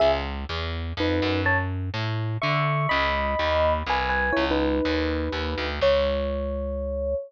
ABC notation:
X:1
M:3/4
L:1/16
Q:1/4=124
K:C#dor
V:1 name="Electric Piano 1"
[Ge] z7 [DB]4 | [c=a] z7 [ec']4 | [db]8 [Bg]2 [Bg]2 | [Ec] [DB]11 |
c12 |]
V:2 name="Electric Bass (finger)" clef=bass
C,,4 E,,4 =F,,2 ^F,,2- | F,,4 =A,,4 =D,4 | C,,4 D,,4 ^B,,,4 | C,,4 D,,4 D,,2 =D,,2 |
C,,12 |]